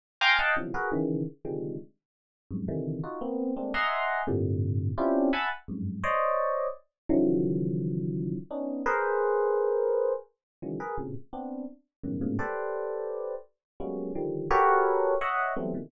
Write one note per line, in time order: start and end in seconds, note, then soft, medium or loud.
0.21 0.37 F5 loud
0.21 0.37 G5 loud
0.21 0.37 G#5 loud
0.21 0.37 A#5 loud
0.21 0.37 C6 loud
0.21 0.37 D6 loud
0.39 0.55 D#5 medium
0.39 0.55 F5 medium
0.39 0.55 F#5 medium
0.39 0.55 G5 medium
0.39 0.55 A5 medium
0.56 0.72 B2 soft
0.56 0.72 C3 soft
0.56 0.72 D3 soft
0.56 0.72 E3 soft
0.56 0.72 F3 soft
0.56 0.72 F#3 soft
0.74 0.90 F#4 medium
0.74 0.90 G#4 medium
0.74 0.90 A#4 medium
0.74 0.90 B4 medium
0.92 1.24 C#3 loud
0.92 1.24 D#3 loud
0.92 1.24 E3 loud
1.45 1.76 C3 medium
1.45 1.76 D3 medium
1.45 1.76 D#3 medium
1.45 1.76 F3 medium
1.45 1.76 G3 medium
1.45 1.76 G#3 medium
2.51 2.66 F2 medium
2.51 2.66 F#2 medium
2.51 2.66 G2 medium
2.51 2.66 G#2 medium
2.68 3.00 C3 medium
2.68 3.00 D3 medium
2.68 3.00 D#3 medium
2.68 3.00 E3 medium
3.04 3.19 D#4 medium
3.04 3.19 F4 medium
3.04 3.19 F#4 medium
3.21 3.53 A#3 medium
3.21 3.53 B3 medium
3.21 3.53 C4 medium
3.56 3.72 G#3 medium
3.56 3.72 A3 medium
3.56 3.72 A#3 medium
3.56 3.72 C4 medium
3.56 3.72 D4 medium
3.74 4.22 D#5 medium
3.74 4.22 E5 medium
3.74 4.22 F#5 medium
3.74 4.22 G#5 medium
3.74 4.22 A#5 medium
3.74 4.22 C6 medium
4.27 4.91 G2 loud
4.27 4.91 A2 loud
4.27 4.91 A#2 loud
4.27 4.91 C3 loud
4.27 4.91 D3 loud
4.98 5.29 C4 medium
4.98 5.29 C#4 medium
4.98 5.29 D4 medium
4.98 5.29 E4 medium
4.98 5.29 F4 medium
4.98 5.29 G4 medium
5.33 5.49 E5 medium
5.33 5.49 F#5 medium
5.33 5.49 G#5 medium
5.33 5.49 A5 medium
5.33 5.49 B5 medium
5.68 6.00 F2 medium
5.68 6.00 F#2 medium
5.68 6.00 G2 medium
5.68 6.00 G#2 medium
6.04 6.67 C5 medium
6.04 6.67 C#5 medium
6.04 6.67 D5 medium
6.04 6.67 D#5 medium
7.09 8.36 C#3 loud
7.09 8.36 D#3 loud
7.09 8.36 E3 loud
7.09 8.36 F3 loud
7.09 8.36 F#3 loud
8.51 8.82 B3 medium
8.51 8.82 C#4 medium
8.51 8.82 D4 medium
8.51 8.82 D#4 medium
8.86 10.13 G#4 loud
8.86 10.13 A#4 loud
8.86 10.13 B4 loud
8.86 10.13 C5 loud
10.62 10.78 C#3 medium
10.62 10.78 D#3 medium
10.62 10.78 E3 medium
10.62 10.78 F#3 medium
10.62 10.78 G#3 medium
10.80 10.96 G#4 medium
10.80 10.96 A#4 medium
10.80 10.96 B4 medium
10.98 11.14 A2 medium
10.98 11.14 A#2 medium
10.98 11.14 B2 medium
10.98 11.14 C3 medium
10.98 11.14 C#3 medium
11.33 11.65 B3 medium
11.33 11.65 C4 medium
11.33 11.65 D4 medium
12.04 12.19 F#2 medium
12.04 12.19 G2 medium
12.04 12.19 A2 medium
12.04 12.19 B2 medium
12.04 12.19 C#3 medium
12.04 12.19 D#3 medium
12.21 12.37 G#2 medium
12.21 12.37 A2 medium
12.21 12.37 A#2 medium
12.21 12.37 B2 medium
12.21 12.37 C#3 medium
12.39 13.34 G4 medium
12.39 13.34 A4 medium
12.39 13.34 B4 medium
12.39 13.34 C5 medium
12.39 13.34 D5 medium
13.80 14.12 F#3 medium
13.80 14.12 G3 medium
13.80 14.12 G#3 medium
13.80 14.12 A#3 medium
13.80 14.12 B3 medium
13.80 14.12 C#4 medium
14.15 14.47 D3 medium
14.15 14.47 D#3 medium
14.15 14.47 F3 medium
14.15 14.47 G3 medium
14.51 15.14 F#4 loud
14.51 15.14 G4 loud
14.51 15.14 A4 loud
14.51 15.14 A#4 loud
14.51 15.14 B4 loud
14.51 15.14 C#5 loud
15.21 15.53 C#5 medium
15.21 15.53 D#5 medium
15.21 15.53 E5 medium
15.21 15.53 F#5 medium
15.56 15.72 E3 medium
15.56 15.72 F#3 medium
15.56 15.72 G3 medium
15.56 15.72 A3 medium
15.56 15.72 B3 medium
15.56 15.72 C4 medium
15.74 15.90 A#2 medium
15.74 15.90 B2 medium
15.74 15.90 C3 medium
15.74 15.90 D3 medium
15.74 15.90 D#3 medium
15.74 15.90 E3 medium